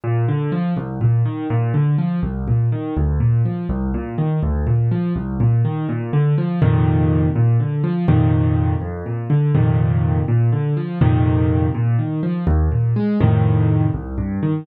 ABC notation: X:1
M:6/8
L:1/8
Q:3/8=82
K:Bb
V:1 name="Acoustic Grand Piano" clef=bass
B,, D, F, C,, B,, E, | B,, D, F, C,, B,, E, | D,, B,, F, C,, B,, E, | D,, B,, F, C,, B,, E, |
B,, D, F, [F,,B,,C,E,]3 | B,, D, F, [F,,B,,C,E,]3 | F,, B,, D, [F,,B,,C,E,]3 | B,, D, F, [F,,B,,C,E,]3 |
B,, E, F, E,, B,, _A, | [F,,A,,C,E,]3 C,, G,, E, |]